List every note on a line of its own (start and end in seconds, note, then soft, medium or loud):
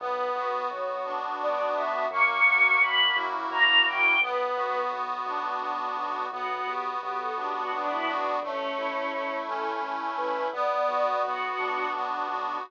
0.00 0.30 B1 medium
0.00 0.70 B3 loud
0.00 0.58 B4 medium
0.35 0.65 B1 medium
0.35 1.75 F#4 medium
0.70 1.00 B1 medium
0.70 1.39 B3 medium
0.70 1.04 C#5 medium
1.05 1.35 B1 medium
1.05 2.05 D4 medium
1.40 1.70 B1 medium
1.40 2.07 B3 medium
1.40 1.73 D5 medium
1.76 2.05 B1 medium
1.76 2.09 F#4 medium
1.76 2.05 E5 medium
2.11 2.40 F#2 medium
2.11 2.79 A#3 loud
2.11 2.77 C#6 loud
2.46 2.76 F#2 medium
2.46 3.86 F#4 medium
2.80 3.11 F#2 medium
2.80 3.49 A#3 medium
2.80 3.12 B5 medium
3.16 3.46 F#2 medium
3.16 4.16 E4 medium
3.50 3.81 F#2 medium
3.50 4.16 A#3 medium
3.50 3.81 A#5 medium
3.86 4.16 F#2 medium
3.86 4.20 F#4 medium
3.86 4.18 G5 medium
4.21 4.51 B1 medium
4.21 4.92 B3 loud
4.21 4.87 B4 loud
4.56 4.86 B1 medium
4.56 5.97 F#4 medium
4.91 5.21 B1 medium
4.91 5.60 B3 loud
5.26 5.56 B1 medium
5.26 6.26 D4 medium
5.61 5.91 B1 medium
5.61 6.27 B3 medium
5.96 6.26 B1 medium
5.96 6.30 F#4 medium
6.31 6.61 B1 medium
6.31 7.01 B3 loud
6.31 6.48 F#4 medium
6.50 6.67 F#4 medium
6.67 6.96 B1 medium
6.67 8.06 F#4 medium
6.67 6.84 G4 medium
7.01 7.31 B1 medium
7.01 7.72 B3 medium
7.01 7.19 G4 medium
7.18 7.35 A4 medium
7.36 7.67 B1 medium
7.36 8.37 D4 medium
7.36 7.53 G4 medium
7.54 7.71 F#4 medium
7.72 8.02 B1 medium
7.72 8.39 B3 medium
7.72 7.89 D4 medium
7.89 8.06 E4 loud
8.06 8.37 B1 medium
8.06 8.24 D4 loud
8.06 8.40 F#4 loud
8.24 8.41 D4 medium
8.42 8.72 A1 medium
8.42 9.12 A3 loud
8.42 9.37 C#4 loud
8.77 9.07 A1 medium
8.77 10.17 E4 medium
9.12 9.42 A1 medium
9.12 9.83 A3 medium
9.47 9.77 A1 medium
9.47 10.48 C#4 medium
9.47 9.78 A4 medium
9.82 10.12 A1 medium
9.82 10.50 A3 medium
10.17 10.48 A1 medium
10.17 10.50 E4 medium
10.17 10.49 B4 loud
10.52 10.82 B1 medium
10.52 11.22 B3 loud
10.52 11.16 D5 medium
10.88 11.17 B1 medium
10.88 12.28 F#4 medium
11.23 11.53 B1 medium
11.23 11.93 B3 medium
11.23 11.90 F#4 medium
11.57 11.88 B1 medium
11.57 12.57 D4 medium
11.93 12.23 B1 medium
11.93 12.61 B3 medium
12.28 12.58 B1 medium
12.28 12.62 F#4 medium